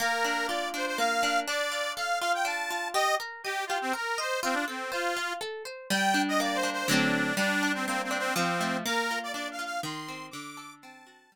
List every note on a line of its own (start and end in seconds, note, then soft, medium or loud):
0.00 0.98 A#3 loud
0.00 0.47 A#4 loud
0.24 0.73 D4 medium
0.47 1.42 F4 medium
0.47 0.69 D5 medium
0.74 1.22 D4 medium
0.74 0.86 C5 medium
0.87 0.98 C5 medium
0.98 1.45 A#3 medium
0.98 1.40 F5 loud
1.23 1.46 D4 medium
1.48 2.44 D4 medium
1.48 1.93 D5 loud
1.72 2.21 F4 medium
1.96 2.90 A4 medium
1.96 2.19 F5 medium
2.20 2.70 F4 medium
2.20 2.32 F5 loud
2.34 2.46 G5 medium
2.45 2.92 D4 medium
2.45 2.88 A5 medium
2.70 2.94 F4 medium
2.94 3.16 G4 loud
2.94 3.15 D#5 loud
3.20 3.42 A#4 medium
3.44 3.65 G4 medium
3.44 3.67 D#5 medium
3.67 3.78 F4 medium
3.67 3.92 G4 medium
3.81 3.93 C4 medium
3.93 4.15 A#4 medium
3.93 4.19 A#4 medium
4.18 4.40 C5 medium
4.18 4.40 D#5 medium
4.43 4.55 C4 loud
4.43 4.65 F4 loud
4.53 4.65 D4 medium
4.68 4.91 C4 medium
4.68 4.90 A4 medium
4.91 5.33 F4 medium
4.91 5.14 C5 medium
5.17 5.39 F4 medium
5.41 5.63 A4 medium
5.65 5.87 C5 medium
5.90 6.84 G3 loud
5.90 6.22 G5 loud
6.14 6.63 D4 medium
6.28 6.40 D#5 loud
6.40 6.87 A#3 medium
6.40 6.57 D5 medium
6.55 6.70 C5 medium
6.63 6.87 D4 medium
6.73 6.88 C5 medium
6.88 7.32 D3 loud
6.88 7.32 F#3 loud
6.88 7.32 A3 medium
6.88 7.32 C4 loud
6.88 7.35 D4 medium
7.37 8.30 G3 loud
7.37 7.72 D4 loud
7.63 8.10 D4 medium
7.74 7.86 C4 medium
7.86 8.34 A#3 medium
7.86 8.02 C4 loud
8.03 8.18 C4 medium
8.11 8.34 D4 medium
8.18 8.34 C4 loud
8.36 8.82 F3 loud
8.36 8.77 C4 medium
8.61 8.84 A3 medium
8.86 9.79 A#3 loud
8.86 9.19 A#4 loud
9.11 9.58 F4 medium
9.23 9.32 D5 medium
9.33 9.81 D4 medium
9.33 9.48 D5 medium
9.51 9.65 F5 medium
9.59 9.82 F4 medium
9.65 9.81 F5 loud
9.83 10.30 D#3 loud
9.83 10.26 C6 medium
10.08 10.32 C4 medium
10.31 11.27 D3 loud
10.31 10.74 D6 loud
10.57 11.27 A4 medium
10.82 11.30 C4 medium
10.82 11.36 A5 medium
11.07 11.30 F#4 medium
11.32 11.36 G3 loud